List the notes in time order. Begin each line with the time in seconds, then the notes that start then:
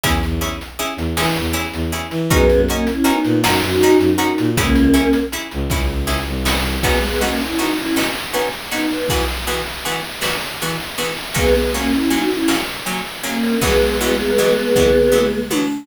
0.03 E2 C#4 E4 G#4, kick, closed hi-hat
0.23 E2, closed hi-hat
0.41 C#4 E4 G#4, closed hi-hat
0.61 closed hi-hat
0.79 C#4 E4 G#4, closed hi-hat
0.97 E2, closed hi-hat
1.17 E3 C#4 E4 G#4, snare
1.36 E2, closed hi-hat
1.53 C#4 E4 G#4, closed hi-hat
1.73 E2, closed hi-hat
1.92 C#4 E4 G#4, closed hi-hat
2.11 E3, closed hi-hat
2.30 F#2 G#3 B3 C#4 D#4 F#4 A#4, kick, closed hi-hat
2.50 F#2, closed hi-hat
2.68 A#3 C#4 D#4 F#4 A#4, closed hi-hat
2.87 C#4 E4, closed hi-hat
3.04 B3 C#4 D#4 F#4 A#4, closed hi-hat
3.25 A#2, closed hi-hat
3.44 F#2 C#4 D#4 F#4 A#4, snare
3.62 F#2, closed hi-hat
3.81 C#4 D#4 F#4 A#4, closed hi-hat
3.98 F#2, closed hi-hat
4.18 C#4 D#4 F#4 A#4, closed hi-hat
4.38 A#2, closed hi-hat
4.56 C#2 A#3 C#4 E4 G#4, kick, closed hi-hat
4.75 C#2, closed hi-hat
4.94 C#4 E4 G#4, closed hi-hat
5.13 closed hi-hat
5.32 C#4 E4 G#4, closed hi-hat
5.51 C#2, closed hi-hat
5.69 C#2 C#4 E4 G#4, kick, snare
6.07 C#4 E4 G#4, snare
6.27 C2
6.45 C#4 E4 G#4, snare
6.83 G#3 B3 C#4 D#4 F#4, kick, crash
7.02 G#3 B3, ride
7.21 A#3 B3 C#4 D#4 F#4, ride
7.40 C#4 E4, ride
7.59 B3 C#4 D#4 F#4, ride
7.77 C#4 E4, ride
7.96 B3 C#4 D#4 F#4, snare
8.15 ride
8.33 B3 C#4 D#4 F#4, ride
8.53 ride
8.72 B3 C#4 D#4 F#4, ride
8.90 ride
9.09 E3 B3 F#4 G#4, kick, ride
9.28 ride
9.47 E3 B3 F#4 G#4, ride
9.66 ride
9.85 E3 B3 F#4 G#4, ride
10.04 ride
10.21 E3 B3 F#4 G#4, snare
10.41 ride
10.61 E3 B3 F#4 G#4, ride
10.80 ride
10.98 E3 B3 F#4 G#4, ride
11.17 ride
11.34 F#3 G#3 A#3 B3 C#4, kick, ride
11.55 G#3 B3, ride
11.74 F#3 A#3 C#4, ride
11.92 C#4 E4, ride
12.10 F#3 A#3 C#4 D#4 F#4, ride
12.31 C#4 E4, ride
12.48 F#3 A#3 C#4, snare
12.68 ride
12.86 F#3 A#3 C#4, ride
13.06 ride
13.23 F#3 A#3 C#4, ride
13.43 ride
13.61 E3 F#3 G#3 B3, kick, ride
13.82 ride
14.00 E3 F#3 G#3 B3, ride
14.19 ride
14.38 E3 F#3 G#3 B3, ride
14.57 ride
14.76 E3 F#3 G#3 B3, kick, floor tom
15.12 E3 F#3 G#3 B3, mid tom
15.50 E3 F#3 G#3 B3, high tom